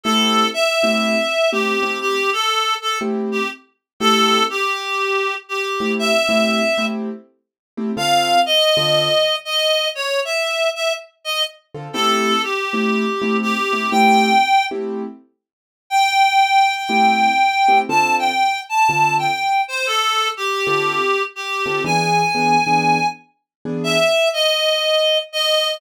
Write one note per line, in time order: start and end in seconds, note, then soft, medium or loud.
0.04 0.43 A3 medium
0.04 0.43 C4 medium
0.04 0.43 E4 medium
0.04 0.43 G4 medium
0.04 0.48 A4 loud
0.54 1.50 E5 loud
0.83 1.15 A3 medium
0.83 1.15 C4 medium
0.83 1.15 E4 medium
0.83 1.15 G4 medium
1.52 1.74 A3 medium
1.52 1.74 C4 medium
1.52 1.74 E4 medium
1.52 1.98 G4 medium
1.52 1.74 G4 medium
1.82 2.14 A3 medium
1.82 2.14 C4 medium
1.82 2.14 E4 medium
1.82 2.14 G4 medium
2.01 2.30 G4 loud
2.33 2.75 A4 loud
2.82 2.99 A4 medium
3.01 3.39 A3 medium
3.01 3.39 C4 medium
3.01 3.39 E4 medium
3.01 3.39 G4 medium
3.32 3.48 G4 medium
4.00 4.39 A3 medium
4.00 4.39 C4 medium
4.00 4.39 E4 medium
4.00 4.39 G4 medium
4.00 4.44 A4 loud
4.50 5.34 G4 medium
5.49 5.92 G4 medium
5.80 6.12 A3 medium
5.80 6.12 C4 medium
5.80 6.12 E4 medium
5.80 6.12 G4 medium
5.99 6.85 E5 loud
6.29 6.60 A3 medium
6.29 6.60 C4 medium
6.29 6.60 E4 medium
6.29 6.60 G4 medium
6.78 7.09 A3 medium
6.78 7.09 C4 medium
6.78 7.09 E4 medium
6.78 7.09 G4 medium
7.77 7.91 A3 medium
7.77 7.91 C4 medium
7.77 7.91 E4 medium
7.77 7.91 G4 medium
7.97 8.35 D3 medium
7.97 8.35 C4 medium
7.97 8.35 F4 medium
7.97 8.35 A4 medium
7.97 8.40 F5 loud
8.46 9.36 D#5 loud
8.77 9.08 D3 medium
8.77 9.08 C4 medium
8.77 9.08 F4 medium
8.77 9.08 A4 medium
9.45 9.88 D#5 medium
9.95 10.20 C#5 loud
10.25 10.69 E5 medium
10.75 10.93 E5 medium
11.24 11.43 D#5 medium
11.74 11.88 D3 medium
11.74 11.88 C4 medium
11.74 11.88 F4 medium
11.74 11.88 A4 medium
11.93 12.32 A3 medium
11.93 12.32 C4 medium
11.93 12.32 E4 medium
11.93 12.32 G4 medium
11.93 12.42 A4 loud
12.43 13.37 G4 medium
12.73 13.05 A3 medium
12.73 13.05 C4 medium
12.73 13.05 E4 medium
12.73 13.05 G4 medium
13.22 13.53 A3 medium
13.22 13.53 C4 medium
13.22 13.53 E4 medium
13.22 13.53 G4 medium
13.42 13.90 G4 medium
13.73 13.86 A3 medium
13.73 13.86 C4 medium
13.73 13.86 E4 medium
13.73 13.86 G4 medium
13.91 14.30 A3 medium
13.91 14.30 C4 medium
13.91 14.30 E4 medium
13.91 14.30 G4 medium
13.91 14.65 G5 loud
14.71 15.02 A3 medium
14.71 15.02 C4 medium
14.71 15.02 E4 medium
14.71 15.02 G4 medium
15.90 17.78 G5 loud
16.89 17.27 A3 medium
16.89 17.27 C4 medium
16.89 17.27 E4 medium
16.89 17.27 G4 medium
17.68 17.82 A3 medium
17.68 17.82 C4 medium
17.68 17.82 E4 medium
17.68 17.82 G4 medium
17.89 18.27 D3 medium
17.89 18.27 C4 medium
17.89 18.27 F4 medium
17.89 18.27 A4 medium
17.89 18.15 A5 loud
18.19 18.61 G5 medium
18.69 19.15 A5 loud
18.89 19.27 D3 medium
18.89 19.27 C4 medium
18.89 19.27 F4 medium
18.89 19.27 A4 medium
19.19 19.61 G5 medium
19.68 19.86 C5 loud
19.86 20.28 A4 loud
20.37 21.22 G4 loud
20.67 20.98 D3 medium
20.67 20.98 C4 medium
20.67 20.98 F4 medium
20.67 20.98 A4 medium
21.36 21.83 G4 medium
21.66 21.79 D3 medium
21.66 21.79 C4 medium
21.66 21.79 F4 medium
21.66 21.79 A4 medium
21.84 22.22 E3 medium
21.84 22.22 B3 medium
21.84 22.22 D4 medium
21.84 22.22 G#4 medium
21.84 23.07 G#5 loud
22.35 22.56 E3 medium
22.35 22.56 B3 medium
22.35 22.56 D4 medium
22.35 22.56 G#4 medium
22.67 22.98 E3 medium
22.67 22.98 B3 medium
22.67 22.98 D4 medium
22.67 22.98 G#4 medium
23.65 23.97 E3 medium
23.65 23.97 B3 medium
23.65 23.97 D4 medium
23.65 23.97 G#4 medium
23.84 24.29 E5 loud
24.33 25.18 D#5 medium
25.33 25.76 D#5 medium